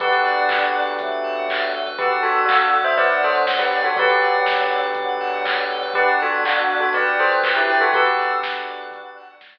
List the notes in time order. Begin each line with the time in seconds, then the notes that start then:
0.00 B1 B3 D4 F#4 G4 A4 B4, kick, closed hi-hat
0.12 B4
0.24 D5, open hi-hat
0.37 F#5
0.49 B2 A5, kick, clap
0.62 B5
0.74 D6, open hi-hat
0.87 F#6
0.99 F#3 A3 D6, kick, closed hi-hat
1.11 B5
1.24 A5, open hi-hat
1.36 F#2 F#5
1.49 D5, kick, clap
1.61 B4
1.73 A4, open hi-hat
1.86 F#2 B4
1.98 B3 D4 F#4 G4 A4 B4 D5, kick, closed hi-hat
2.11 F#5
2.23 F#4 A4 A5, open hi-hat
2.36 B5
2.46 D4 F#4 D6, kick, clap
2.60 F#6
2.72 D6, open hi-hat
2.84 C5 E5 B5
2.97 D3 F#3 B4 D5 A5, kick, closed hi-hat
3.10 F#5
3.22 A4 C5 D5, open hi-hat
3.35 B4
3.46 A4, kick, snare
3.59 G4 B4
3.72 D5, open hi-hat
3.84 F#4 A4 F#5
3.96 B1 D3 F#3 B3 D4 F#4 G4 A4 B4, kick, closed hi-hat
4.09 B4
4.21 D5, open hi-hat
4.34 F#5
4.46 B1 A5, kick, snare
4.59 B5
4.71 D6, open hi-hat
4.83 F#6
4.95 D3 F#3 D6, kick, closed hi-hat
5.08 B5
5.20 A5, open hi-hat
5.33 B1 F#5
5.45 D5, kick, clap
5.58 B4
5.70 A4, open hi-hat
5.82 B1 B4
5.94 B3 D4 F#4 G4 A4 B4 D5, kick, closed hi-hat
6.08 F#5
6.20 F#4 A4 A5, open hi-hat
6.32 B5
6.44 D4 F#4 D6, kick, clap
6.57 F#6
6.70 D6, open hi-hat
6.80 F#4 A4 B5
6.93 G4 B4 D5 A5, kick, closed hi-hat
7.06 F#5
7.19 A4 C5 D5, open hi-hat
7.32 B4
7.43 A4, kick, clap
7.56 E4 G4 B4
7.69 D5, open hi-hat
7.81 F#4 A4 F#5
7.93 B1 B3 D4 F#4 G4 A4 B4, kick, closed hi-hat
8.05 B4
8.18 D5, open hi-hat
8.30 F#5
8.43 B1 D4 F#4 A5, kick, snare
8.55 B5
8.67 D6, open hi-hat
8.80 F#6
8.91 B3 D4 F#4 A4 D6, kick, closed hi-hat
9.05 B5
9.17 A5, open hi-hat
9.29 B1 F#5
9.41 D5, kick, snare
9.54 B4